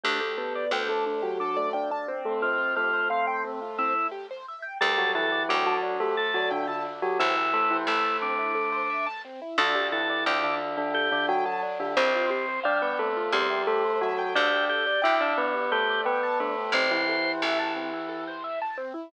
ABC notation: X:1
M:7/8
L:1/16
Q:1/4=88
K:Dmix
V:1 name="Tubular Bells"
[A,A] [A,A] [B,B]2 [A,A] [A,A]2 [F,F]2 [A,A] [Dd] [Dd] z [A,A] | [Cc]2 [A,A]8 z4 | [G,G] [F,F] [E,E]2 [F,F] [F,F]2 [A,A]2 [F,F] [D,D] [D,D] z [F,F] | [E,E]2 [A,A] [E,E] [A,A]6 z4 |
[D,D] [D,D] [E,E]2 [D,D] [D,D]2 [D,D]2 [D,D] [F,F] [F,F] z [D,D] | [Cc]2 z2 [Dd] [B,B] [A,A]2 [G,G]2 [A,A]2 [F,F]2 | [Dd]2 z2 [Ee] [Dd] [B,B]2 [A,A]2 [B,B]2 [A,A]2 | [C,C] [E,E]9 z4 |]
V:2 name="Drawbar Organ"
G2 G2 D2 z2 D2 z4 | =F2 F2 C2 z2 E2 z4 | A2 A2 D2 z2 A2 z4 | E4 E2 D6 z2 |
A2 A2 D2 z2 G2 z4 | C2 C2 G,2 z2 C2 z4 | G2 G2 D2 z2 G2 z4 | c4 z10 |]
V:3 name="Acoustic Grand Piano"
D G A d g a D G A d g a C2- | C =F G c =f g C F C E G c e g | D G A d g a D G A d g a D G | C E A c e a C E A c e a C E |
D G A d g a D G A d g a D G | C =F G c =f g C F C E G c e g | D G A d g a D G A d g a D G | C E A c e a C E A c e a C E |]
V:4 name="Electric Bass (finger)" clef=bass
D,,4 D,,10 | z14 | D,,4 D,,10 | A,,,4 A,,,10 |
D,,4 D,,10 | C,,8 E,,6 | D,,4 D,,10 | A,,,4 A,,,10 |]